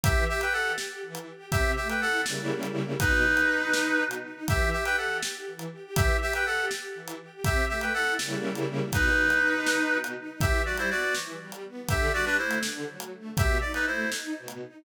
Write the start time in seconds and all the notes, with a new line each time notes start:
0.03 E3 G4 E5, kick, closed hi-hat
0.28 G4 E5
0.41 B4 G5, closed hi-hat
0.53 G4 A4 F#5
0.78 G4, snare
1.03 E3
1.15 closed hi-hat
1.27 G4
1.51 C3 G4 E5, kick, closed hi-hat
1.76 A3 G4 E5
1.89 B4 G5, closed hi-hat
2.01 E4 A4 F#5
2.26 C#3 G3 A#3 E4, snare
2.63 closed hi-hat
3.00 B2 D#4 B4, kick, closed hi-hat
3.25 D#4
3.37 closed hi-hat
3.49 D#4
3.73 D#4, snare
3.99 B2
4.11 closed hi-hat
4.24 D#4
4.48 E3 G4 E5, kick, closed hi-hat
4.72 G4 E5
4.85 B4 G5, closed hi-hat
4.97 G4 A4 F#5
5.22 G4, snare
5.47 E3
5.59 closed hi-hat
5.72 G4
5.96 E3 G4 E5, kick, closed hi-hat
6.21 G4 E5
6.33 B4 G5, closed hi-hat
6.46 G4 A4 F#5
6.70 G4, snare
6.95 E3
7.08 closed hi-hat
7.20 G4
7.44 C3 G4 E5, kick, closed hi-hat
7.69 A3 G4 E5
7.81 B4 G5, closed hi-hat
7.94 E4 A4 F#5
8.19 C#3 G3 A#3 E4, snare
8.55 closed hi-hat
8.92 B2 D#4 B4, kick, closed hi-hat
9.17 D#4
9.30 closed hi-hat
9.42 D#4
9.67 D#4, snare
9.91 B2
10.04 closed hi-hat
10.16 D#4
10.41 E3 G4 E5, kick, closed hi-hat
10.65 G3 F#4 D5
10.77 E4 C5, closed hi-hat
10.90 B3 F#4 D5
11.15 E3, snare
11.40 G3
11.52 closed hi-hat
11.64 B3
11.89 D3 G4 E5, kick, closed hi-hat
12.13 G3 F#4 D5
12.25 D4 B4
12.38 A3 E4 C5
12.51 closed hi-hat
12.63 D3, snare
12.87 F#3
13.00 closed hi-hat
13.12 A3
13.37 B2 G4 E5, kick, closed hi-hat
13.61 D#4 D5
13.74 D#4 B4, closed hi-hat
13.86 A3 E4 C5
14.11 D#4, snare
14.36 B2
14.48 closed hi-hat
14.61 D#4